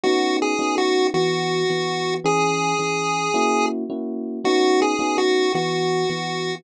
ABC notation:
X:1
M:4/4
L:1/8
Q:1/4=109
K:B
V:1 name="Lead 1 (square)"
(3F2 G2 F2 F4 | G6 z2 | (3F2 G2 F2 F4 |]
V:2 name="Electric Piano 1"
[B,CDF]2 [B,CDF]2 [E,B,F]2 [E,B,F]2 | [E,CG]2 [E,CG]2 [A,CEF]2 [A,CEF]2 | [B,CDF]2 [B,CDF]2 [E,B,F]2 [E,B,F]2 |]